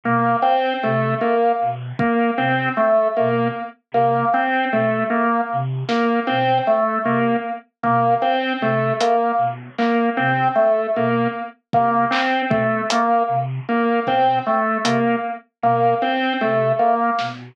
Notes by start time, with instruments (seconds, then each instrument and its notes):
0.04 flute B2, drawbar organ A#3
0.42 drawbar organ C4
0.83 flute C3, drawbar organ A3
1.21 drawbar organ A#3
1.61 flute B2
1.99 drawbar organ A#3, kick
2.38 flute C3, drawbar organ C4
2.77 drawbar organ A3
3.17 flute B2, drawbar organ A#3
3.92 flute C3, drawbar organ A#3
4.34 drawbar organ C4
4.72 flute B2, drawbar organ A3
5.10 drawbar organ A#3
5.52 flute C3
5.88 drawbar organ A#3, snare
6.27 flute B2, drawbar organ C4
6.67 drawbar organ A3
7.04 flute C3, drawbar organ A#3
7.83 flute B2, drawbar organ A#3, kick
8.22 drawbar organ C4
8.61 flute C3, drawbar organ A3
9.00 drawbar organ A#3, closed hi-hat
9.38 flute B2
9.78 drawbar organ A#3, clap
10.17 flute C3, drawbar organ C4
10.56 drawbar organ A3
10.95 flute B2, drawbar organ A#3
11.73 flute C3, drawbar organ A#3, kick
12.11 drawbar organ C4, clap
12.50 flute B2, drawbar organ A3, kick
12.90 drawbar organ A#3, closed hi-hat
13.28 flute C3
13.69 drawbar organ A#3
14.07 flute B2, drawbar organ C4, kick
14.46 drawbar organ A3
14.84 flute C3, drawbar organ A#3, closed hi-hat
15.62 flute B2, drawbar organ A#3
16.02 drawbar organ C4
16.41 flute C3, drawbar organ A3
16.79 drawbar organ A#3
17.19 flute B2, snare